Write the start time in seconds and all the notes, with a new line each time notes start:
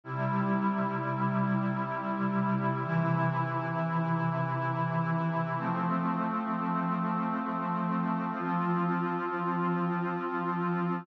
0.04 C3 G3 E4
2.79 C3 E3 E4
5.55 F3 A3 C4
8.31 F3 C4 F4